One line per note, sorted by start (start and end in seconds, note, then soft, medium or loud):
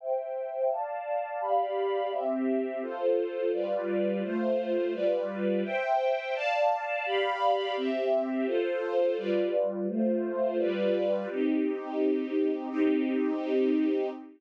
0.00 0.70 C5 medium
0.00 0.70 E5 medium
0.00 0.70 G5 medium
0.71 1.41 D5 medium
0.71 1.41 F5 medium
0.71 1.41 A5 medium
1.41 2.11 G4 medium
1.41 2.11 D5 medium
1.41 2.11 F5 medium
1.41 2.11 B5 medium
2.12 2.82 C4 medium
2.12 2.82 G4 medium
2.12 2.82 E5 medium
2.82 3.52 F4 medium
2.82 3.52 A4 medium
2.82 3.52 C5 medium
3.53 4.23 G3 medium
3.53 4.23 F4 medium
3.53 4.23 B4 medium
3.53 4.23 D5 medium
4.23 4.93 A3 medium
4.23 4.93 F4 medium
4.23 4.93 C5 medium
4.94 5.64 G3 medium
4.94 5.64 F4 medium
4.94 5.64 B4 medium
4.94 5.64 D5 medium
5.64 6.34 C5 medium
5.64 6.34 E5 medium
5.64 6.34 G5 medium
6.35 7.05 D5 medium
6.35 7.05 F5 medium
6.35 7.05 A5 medium
7.06 7.76 G4 medium
7.06 7.76 D5 medium
7.06 7.76 F5 medium
7.06 7.76 B5 medium
7.77 8.47 C4 medium
7.77 8.47 G4 medium
7.77 8.47 E5 medium
8.47 9.17 F4 medium
8.47 9.17 A4 medium
8.47 9.17 C5 medium
9.18 9.87 G3 medium
9.18 9.87 F4 medium
9.18 9.87 B4 medium
9.18 9.87 D5 medium
9.88 10.58 A3 medium
9.88 10.58 F4 medium
9.88 10.58 C5 loud
10.58 11.28 G3 medium
10.58 11.28 F4 medium
10.58 11.28 B4 medium
10.58 11.28 D5 medium
11.30 12.69 C4 medium
11.30 12.69 D#4 medium
11.30 12.69 G4 medium
12.70 14.09 C4 medium
12.70 14.09 D#4 loud
12.70 14.09 G4 medium